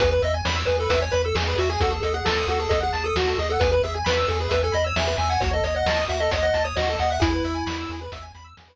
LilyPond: <<
  \new Staff \with { instrumentName = "Lead 1 (square)" } { \time 4/4 \key e \major \tempo 4 = 133 b'16 b'16 dis''16 r16 cis''8 b'16 a'16 b'16 cis''16 b'16 a'16 gis'8 fis'16 gis'16 | a'16 gis'16 a'16 gis'16 a'8 a'16 gis'16 a'16 gis'8 a'16 fis'8 gis'16 a'16 | b'16 b'16 gis'16 r16 b'8 a'16 gis'16 b'16 a'16 dis''16 cis''16 e''8 gis''16 fis''16 | cis''16 dis''16 cis''16 dis''16 dis''8 e''16 dis''16 cis''16 dis''8 cis''16 dis''8 fis''16 e''16 |
e'2 r2 | }
  \new Staff \with { instrumentName = "Lead 1 (square)" } { \time 4/4 \key e \major gis'16 b'16 e''16 gis''16 b''16 e'''16 gis'16 b'16 e''16 gis''16 b''16 e'''16 gis'16 b'16 e''16 gis''16 | fis'16 a'16 dis''16 fis''16 a''16 dis'''16 fis'16 a'16 dis''16 fis''16 a''16 dis'''16 fis'16 a'16 dis''16 fis''16 | gis'16 b'16 e''16 gis''16 b''16 e'''16 gis'16 b'16 e''16 gis''16 b''16 e'''16 gis'16 b'16 e''16 gis''16 | fis'16 a'16 dis''16 fis''16 a''16 dis'''16 fis'16 a'16 dis''16 fis''16 a''16 dis'''16 fis'16 a'16 dis''16 fis''16 |
gis'16 b'16 e''16 gis''16 b''16 e'''16 gis'16 b'16 e''16 gis''16 b''16 e'''16 gis'16 b'16 r8 | }
  \new Staff \with { instrumentName = "Synth Bass 1" } { \clef bass \time 4/4 \key e \major e,8 e,8 e,8 e,8 e,8 e,8 e,8 e,8 | dis,8 dis,8 dis,8 dis,8 dis,8 dis,8 dis,8 dis,8 | e,8 e,8 e,8 e,8 e,8 e,8 e,8 e,8 | dis,8 dis,8 dis,8 dis,8 dis,8 dis,8 dis,8 dis,8 |
e,8 e,8 e,8 e,8 e,8 e,8 e,8 r8 | }
  \new DrumStaff \with { instrumentName = "Drums" } \drummode { \time 4/4 <hh bd>8 hh8 sn8 hh8 <hh bd>8 hh8 sn8 hh8 | <hh bd>8 hh8 sn8 hh8 <hh bd>8 hh8 sn8 hh8 | <hh bd>8 hh8 sn8 hh8 <hh bd>8 hh8 sn8 hh8 | <hh bd>8 hh8 sn8 hh8 <hh bd>8 hh8 sn8 hh8 |
<hh bd>8 hh8 sn8 hh8 <hh bd>8 hh8 sn4 | }
>>